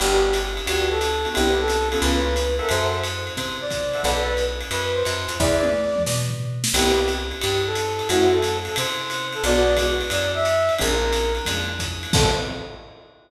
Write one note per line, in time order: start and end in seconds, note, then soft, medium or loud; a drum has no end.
0.00 0.60 G1 loud
0.00 0.27 B3 loud
0.00 0.27 D4 medium
0.00 0.27 F#4 loud
0.00 0.27 G4 medium
0.00 0.34 G4 loud
0.00 crash medium
0.00 ride medium
0.33 hi-hat pedal medium
0.33 ride medium
0.57 ride medium
0.66 1.26 D2 medium
0.66 0.94 B3 medium
0.66 0.94 D4 medium
0.66 0.94 F#4 medium
0.66 0.94 G4 medium
0.66 0.89 G4 medium
0.66 ride medium
0.91 1.29 A4 medium
1.01 hi-hat pedal medium
1.01 ride medium
1.25 1.33 B3 medium
1.25 1.33 D4 medium
1.25 1.33 F#4 medium
1.25 1.33 G4 medium
1.25 ride medium
1.34 1.96 C2 loud
1.34 1.61 B3 medium
1.34 1.61 C4 loud
1.34 1.61 D4 medium
1.34 1.61 E4 medium
1.34 1.54 G4 loud
1.34 ride medium
1.59 1.89 A4 loud
1.68 hi-hat pedal medium
1.68 ride medium
1.90 2.30 A#3 medium
1.90 2.30 B3 loud
1.90 2.30 C#4 loud
1.90 2.30 F4 medium
1.90 2.00 A4 medium
1.90 ride medium
2.01 2.61 C#2 loud
2.01 2.46 B4 medium
2.01 ride medium
2.36 hi-hat pedal medium
2.36 ride medium
2.59 2.97 A4 loud
2.59 2.70 A#4 medium
2.59 2.97 C5 medium
2.59 2.97 E5 medium
2.59 2.97 F#5 medium
2.59 ride soft
2.69 3.30 F#2 loud
2.69 2.99 C5 loud
2.69 ride medium
3.04 hi-hat pedal medium
3.04 ride medium
3.27 ride medium
3.36 3.96 C3 medium
3.36 3.57 C5 medium
3.36 kick soft
3.36 ride medium
3.61 4.01 D5 medium
3.71 kick medium
3.71 hi-hat pedal medium
3.71 ride medium
3.94 4.02 A4 medium
3.94 4.02 C5 medium
3.94 4.02 E5 medium
3.94 4.02 F#5 medium
3.94 ride medium
4.03 4.63 B1 loud
4.03 4.32 A4 loud
4.03 4.35 B4 medium
4.03 4.32 B4 medium
4.03 4.32 D5 loud
4.03 4.32 F#5 medium
4.03 kick medium
4.03 ride medium
4.37 hi-hat pedal medium
4.37 ride medium
4.61 ride medium
4.71 5.03 F#2 medium
4.71 4.92 B4 medium
4.71 ride medium
4.94 5.35 C5 medium
5.05 5.27 F#2 medium
5.05 hi-hat pedal medium
5.05 ride medium
5.28 5.38 F2 medium
5.28 ride medium
5.40 5.99 E2 loud
5.40 5.67 G#4 medium
5.40 5.67 B4 loud
5.40 5.67 D5 medium
5.40 6.03 D5 loud
5.40 5.67 E5 medium
5.40 kick medium
5.40 snare medium
5.63 high tom medium
5.96 mid tom medium
6.06 6.65 B2 medium
6.06 snare medium
6.30 floor tom medium
6.64 snare medium
6.74 7.33 C2 loud
6.74 7.01 B3 loud
6.74 7.01 C4 medium
6.74 7.01 E4 medium
6.74 7.01 G4 loud
6.74 7.06 G4 loud
6.74 kick soft
6.74 crash medium
6.74 ride loud
7.08 hi-hat pedal medium
7.08 ride medium
7.31 ride medium
7.42 8.02 G2 loud
7.42 7.61 G4 medium
7.42 ride medium
7.66 8.08 A4 medium
7.75 hi-hat pedal medium
7.75 ride medium
7.99 ride medium
8.09 8.69 F#2 loud
8.09 8.38 A3 loud
8.09 8.38 C4 medium
8.09 8.38 E4 medium
8.09 8.28 F#4 loud
8.09 8.38 F#4 loud
8.09 ride medium
8.33 8.58 A4 medium
8.42 hi-hat pedal medium
8.42 ride medium
8.65 8.76 A4 medium
8.65 ride medium
8.76 9.37 C3 loud
8.76 9.26 C5 medium
8.76 ride loud
9.10 hi-hat pedal medium
9.10 ride medium
9.33 9.43 A4 medium
9.33 ride medium
9.44 10.03 B1 loud
9.44 9.72 G#3 medium
9.44 9.72 B3 loud
9.44 9.72 D4 loud
9.44 9.72 F#4 loud
9.44 9.77 D5 loud
9.44 ride medium
9.77 10.06 G#3 medium
9.77 10.06 B3 medium
9.77 10.06 D4 medium
9.77 10.06 F#4 medium
9.77 kick soft
9.77 hi-hat pedal medium
9.77 ride medium
10.01 ride medium
10.10 10.70 F#2 loud
10.10 10.31 D5 medium
10.10 ride medium
10.35 10.74 E5 medium
10.45 hi-hat pedal medium
10.45 ride medium
10.69 ride medium
10.79 11.40 A#1 loud
10.79 11.07 G#3 loud
10.79 11.07 A#3 loud
10.79 11.07 C4 medium
10.79 11.07 D4 loud
10.79 11.33 A#4 medium
10.79 kick medium
10.79 ride medium
11.13 hi-hat pedal medium
11.13 ride medium
11.35 ride medium
11.45 12.06 F2 loud
11.45 11.74 G#3 medium
11.45 11.74 A#3 medium
11.45 11.74 C4 medium
11.45 11.74 D4 medium
11.45 kick soft
11.45 ride medium
11.79 kick medium
11.79 hi-hat pedal medium
11.79 ride medium
12.03 ride medium
12.13 12.31 A2 loud
12.13 12.30 B3 medium
12.13 12.30 C4 loud
12.13 12.30 G4 loud
12.13 12.29 A4 loud
12.13 12.30 A4 medium
12.13 kick loud
12.13 crash loud